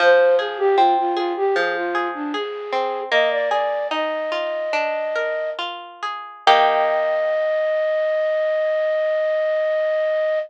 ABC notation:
X:1
M:4/4
L:1/16
Q:1/4=77
K:Eb
V:1 name="Flute"
c2 A G F F F G A F2 D A4 | "^rit." e d d2 e8 z4 | e16 |]
V:2 name="Acoustic Guitar (steel)"
F,2 A2 C2 A2 F,2 A2 A2 C2 | "^rit." B,2 A2 E2 F2 D2 B2 F2 A2 | [E,B,G]16 |]